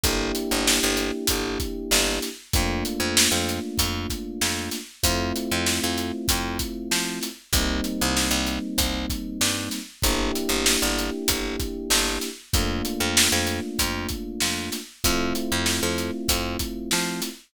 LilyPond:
<<
  \new Staff \with { instrumentName = "Electric Piano 1" } { \time 4/4 \key g \minor \tempo 4 = 96 <bes d' e' g'>1 | <a bes d' f'>1 | <a c' e' f'>1 | <g bes c' ees'>1 |
<bes d' e' g'>1 | <a bes d' f'>1 | <a c' e' f'>1 | }
  \new Staff \with { instrumentName = "Electric Bass (finger)" } { \clef bass \time 4/4 \key g \minor g,,8. g,,8 g,,8. g,,4 g,,4 | f,8. f,8 f,8. f,4 f,4 | f,8. f,8 f,8. f,4 f4 | c,8. c,8 c,8. c,4 g,4 |
g,,8. g,,8 g,,8. g,,4 g,,4 | f,8. f,8 f,8. f,4 f,4 | f,8. f,8 f,8. f,4 f4 | }
  \new DrumStaff \with { instrumentName = "Drums" } \drummode { \time 4/4 <hh bd>8 hh8 sn8 hh8 <hh bd>8 <hh bd>8 sn8 <hh sn>8 | <hh bd>8 hh8 sn8 hh8 <hh bd>8 <hh bd>8 sn8 <hh sn>8 | <hh bd>8 hh8 sn8 hh8 <hh bd>8 <hh bd>8 sn8 <hh sn>8 | <hh bd>8 hh8 sn8 hh8 <hh bd>8 <hh bd>8 sn8 <hh sn>8 |
<hh bd>8 hh8 sn8 hh8 <hh bd>8 <hh bd>8 sn8 <hh sn>8 | <hh bd>8 hh8 sn8 hh8 <hh bd>8 <hh bd>8 sn8 <hh sn>8 | <hh bd>8 hh8 sn8 hh8 <hh bd>8 <hh bd>8 sn8 <hh sn>8 | }
>>